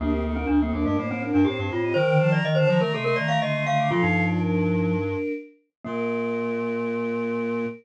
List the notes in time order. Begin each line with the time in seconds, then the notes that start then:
0.00 D2 A#3 D4 G4
0.12 C4
0.24 C4 D#4 A4
0.36 C4 D4 A#4
0.47 D2 D4
0.61 A#3 C4 A4
0.73 D#2 A#3 D4 A#4
0.85 G2 A3 D4 A#4
0.97 A2 A3 A#3 D#4 C5
1.09 A2 C4 D#4 C5
1.22 C4 D4 A#4
1.34 G2 D4
1.45 A2 C4 D#4 G4 C5
1.58 G2 C4 D#4 C5
1.71 A2 C4 D#4 F4 C5
1.83 C4 G4 D#5
1.94 D#3 A#4 C5 G5
2.08 D3
2.19 F3 C5 A5
2.32 D5 A#5
2.43 D#3 D#5
2.55 D3 C5 A5
2.67 D#3 F3 C5 D5 A#5
2.80 D#3 A3 A#4 D5 A#5
2.92 C3 A3 A4 D#5 C6
3.04 A3 A#4 D#5 C6
3.16 D#3 D5 A#5
3.28 A3 F5
3.41 D3 A3 D#5 C6
3.53 D3 A3 D#5 C6
3.66 D3 A3 D#5 F5 C6
3.78 D3 F5 D6
3.90 A#2 F3 F4 A4 F5
4.02 G2 D#4
4.27 F4 D5
4.39 D4 A#4
5.84 A#2 A#3 A#4